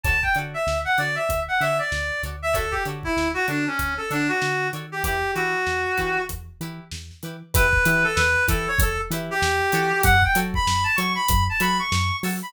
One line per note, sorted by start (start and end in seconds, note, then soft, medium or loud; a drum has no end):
0.04 0.24 D2 medium
0.04 0.17 F#4 medium
0.04 0.17 A4 medium
0.04 0.17 C#5 medium
0.04 0.17 D5 medium
0.04 0.21 A5 medium
0.04 kick loud
0.04 closed hi-hat medium
0.23 0.35 G5 medium
0.23 kick medium
0.35 0.55 D3 medium
0.35 0.59 A4 medium
0.35 0.59 C#5 medium
0.35 0.59 D5 medium
0.35 closed hi-hat medium
0.39 0.59 F#4 medium
0.54 0.78 E5 medium
0.67 0.86 D2 medium
0.67 snare loud
0.85 0.97 F#5 medium
0.98 1.18 D3 medium
0.98 1.22 F#4 medium
0.98 1.22 A4 medium
0.98 1.22 C#5 medium
0.98 1.15 D5 medium
0.98 1.22 D5 medium
0.98 snare soft
0.98 closed hi-hat medium
1.15 1.40 E5 medium
1.29 1.49 D2 medium
1.29 kick medium
1.29 closed hi-hat loud
1.48 1.60 F#5 medium
1.60 1.80 D3 medium
1.60 1.85 F#4 medium
1.60 1.85 A4 medium
1.60 1.85 C#5 medium
1.60 1.85 D5 medium
1.60 1.78 E5 medium
1.60 closed hi-hat medium
1.79 2.22 D5 medium
1.92 2.11 D2 medium
1.92 snare loud
2.23 2.74 D2 medium
2.23 2.36 F#4 medium
2.23 2.36 A4 medium
2.23 2.36 C#5 medium
2.23 2.36 D5 medium
2.23 closed hi-hat medium
2.42 2.55 E5 medium
2.53 2.66 F#4 medium
2.53 2.72 A4 medium
2.53 2.66 A4 medium
2.53 2.66 C#5 loud
2.53 2.66 D5 medium
2.53 kick loud
2.53 closed hi-hat loud
2.71 2.83 G4 medium
2.71 kick medium
2.85 3.05 D3 medium
2.85 3.10 F#4 medium
2.85 3.10 A4 medium
2.85 3.10 C#5 medium
2.85 3.10 D5 medium
2.85 closed hi-hat medium
3.03 3.28 E4 medium
3.03 kick medium
3.17 3.36 D2 medium
3.17 snare loud
3.34 3.46 F#4 medium
3.48 3.68 D3 medium
3.48 3.65 D4 medium
3.48 3.71 F#4 medium
3.48 3.71 A4 medium
3.48 3.71 C#5 medium
3.48 3.71 D5 medium
3.48 closed hi-hat medium
3.67 3.94 C#4 medium
3.79 3.99 D2 medium
3.79 kick medium
3.79 closed hi-hat loud
3.97 4.09 A4 medium
4.10 4.30 D3 medium
4.10 4.28 D4 medium
4.10 4.34 F#4 medium
4.10 4.34 A4 medium
4.10 4.34 C#5 medium
4.10 4.34 D5 medium
4.10 snare soft
4.10 closed hi-hat medium
4.28 4.68 F#4 medium
4.42 4.70 D3 medium
4.42 snare loud
4.73 5.02 D#3 medium
4.73 4.86 F#4 medium
4.73 4.86 A4 medium
4.73 4.86 C#5 medium
4.73 4.86 D5 medium
4.73 closed hi-hat medium
4.92 5.03 G4 medium
5.03 5.24 E2 medium
5.03 5.18 E4 medium
5.03 5.31 G4 medium
5.03 5.18 G4 medium
5.03 5.18 B4 medium
5.03 kick loud
5.03 closed hi-hat loud
5.35 5.55 E3 medium
5.35 5.59 E4 medium
5.35 6.22 F#4 medium
5.35 5.59 G4 medium
5.35 5.59 B4 medium
5.35 closed hi-hat medium
5.67 5.86 E2 medium
5.67 snare loud
5.98 6.18 E3 medium
5.98 6.21 E4 medium
5.98 6.21 G4 medium
5.98 6.21 B4 medium
5.98 kick medium
5.98 snare soft
5.98 closed hi-hat medium
6.29 6.49 E2 medium
6.29 kick medium
6.29 closed hi-hat loud
6.60 6.80 E3 medium
6.60 6.85 E4 medium
6.60 6.85 G4 medium
6.60 6.85 B4 medium
6.60 closed hi-hat medium
6.91 7.11 E2 medium
6.91 snare loud
7.11 snare soft
7.23 7.43 E3 medium
7.23 7.36 E4 medium
7.23 7.36 G4 medium
7.23 7.36 B4 medium
7.23 closed hi-hat medium
7.54 7.74 E2 loud
7.54 7.67 E4 loud
7.54 7.67 G4 loud
7.54 7.67 B4 loud
7.54 8.03 B4 medium
7.54 kick loud
7.54 closed hi-hat loud
7.73 kick loud
7.85 8.05 E3 loud
7.85 8.09 E4 loud
7.85 8.09 G4 loud
7.85 8.09 B4 loud
7.85 closed hi-hat loud
8.04 8.16 A4 medium
8.15 8.36 E2 loud
8.15 8.44 B4 medium
8.15 snare loud
8.48 8.67 E3 loud
8.48 8.71 E4 loud
8.48 8.71 G4 loud
8.48 8.66 A4 medium
8.48 8.71 B4 loud
8.48 kick loud
8.48 closed hi-hat loud
8.68 8.80 C#5 medium
8.79 8.99 E2 loud
8.79 8.98 A4 medium
8.79 kick loud
8.79 closed hi-hat loud
9.10 9.30 E3 loud
9.10 9.35 E4 loud
9.10 9.35 G4 loud
9.10 9.35 B4 loud
9.10 snare soft
9.10 closed hi-hat loud
9.31 10.02 G4 medium
9.42 9.61 E2 loud
9.42 snare loud
9.61 snare soft
9.72 9.93 E3 loud
9.72 10.17 F#4 loud
9.72 10.17 A4 loud
9.72 10.17 C#5 loud
9.72 snare soft
9.72 closed hi-hat loud
10.03 10.24 F#2 loud
10.03 10.21 F#5 medium
10.03 kick loud
10.03 closed hi-hat loud
10.22 10.37 G5 medium
10.22 kick loud
10.35 10.55 F#3 loud
10.35 10.59 F#4 loud
10.35 10.59 A4 loud
10.35 10.59 C#5 loud
10.35 closed hi-hat loud
10.54 10.84 B5 medium
10.54 kick loud
10.67 10.86 F#2 medium
10.67 snare loud
10.84 10.96 A5 medium
10.96 11.17 F#3 loud
10.96 11.22 A4 loud
10.96 11.22 C#5 loud
10.96 11.13 C#6 medium
10.96 closed hi-hat loud
11.00 11.22 F#4 loud
11.15 11.44 B5 medium
11.29 11.49 F#2 loud
11.29 kick loud
11.29 closed hi-hat loud
11.49 11.62 A5 medium
11.60 11.80 F#3 loud
11.60 11.84 F#4 loud
11.60 11.84 A4 loud
11.60 11.84 C#5 loud
11.60 11.77 B5 medium
11.60 closed hi-hat loud
11.79 12.16 C#6 medium
11.79 snare soft
11.92 12.11 F#2 loud
11.92 snare loud
12.23 12.43 F#3 loud
12.23 12.36 F#4 loud
12.23 12.36 A4 loud
12.23 12.36 C#5 loud
12.23 open hi-hat loud
12.42 12.53 B5 medium